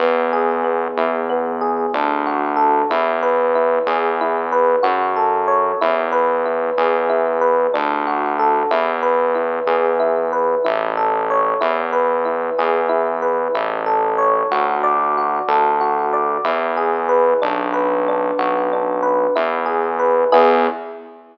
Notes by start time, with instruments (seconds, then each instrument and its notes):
0.00 synth bass 1 E2, electric piano 1 B3
0.33 electric piano 1 G#4
0.64 electric piano 1 B3
0.97 synth bass 1 E2, electric piano 1 E4
1.30 electric piano 1 B3
1.61 electric piano 1 G#4
1.94 synth bass 1 D2, electric piano 1 D4
2.26 electric piano 1 F#4
2.56 electric piano 1 A4
2.90 synth bass 1 E2, electric piano 1 E4
3.23 electric piano 1 B4
3.55 electric piano 1 E4
3.87 synth bass 1 E2, electric piano 1 G#4
4.21 electric piano 1 E4
4.52 electric piano 1 B4
4.83 synth bass 1 F#2, electric piano 1 F#4
5.16 electric piano 1 A4
5.48 electric piano 1 C#5
5.81 synth bass 1 E2, electric piano 1 E4
6.12 electric piano 1 B4
6.46 electric piano 1 E4
6.78 synth bass 1 E2, electric piano 1 G#4
7.10 electric piano 1 E4
7.41 electric piano 1 B4
7.74 synth bass 1 D2, electric piano 1 D4
8.07 electric piano 1 F#4
8.39 electric piano 1 A4
8.71 synth bass 1 E2, electric piano 1 E4
9.03 electric piano 1 B4
9.35 electric piano 1 E4
9.67 synth bass 1 E2, electric piano 1 G#4
10.00 electric piano 1 E4
10.33 electric piano 1 B4
10.65 synth bass 1 A1, electric piano 1 E4
10.97 electric piano 1 A4
11.30 electric piano 1 C#5
11.61 synth bass 1 E2, electric piano 1 E4
11.93 electric piano 1 B4
12.25 electric piano 1 E4
12.58 synth bass 1 E2, electric piano 1 G#4
12.89 electric piano 1 E4
13.22 electric piano 1 B4
13.54 synth bass 1 A1, electric piano 1 E4
13.86 electric piano 1 A4
14.18 electric piano 1 C#5
14.51 synth bass 1 D2, electric piano 1 F#4
14.83 electric piano 1 D5
15.18 electric piano 1 F#4
15.48 synth bass 1 D2, electric piano 1 A4
15.81 electric piano 1 F#4
16.13 electric piano 1 D5
16.44 synth bass 1 E2, electric piano 1 E4
16.77 electric piano 1 G#4
17.09 electric piano 1 B4
17.42 synth bass 1 B1, electric piano 1 D4
17.73 electric piano 1 B4
18.08 electric piano 1 D4
18.38 synth bass 1 B1, electric piano 1 F#4
18.73 electric piano 1 D4
19.03 electric piano 1 B4
19.35 synth bass 1 E2, electric piano 1 E4
19.66 electric piano 1 G#4
19.99 electric piano 1 B4
20.32 synth bass 1 E2, electric piano 1 B3 E4 G#4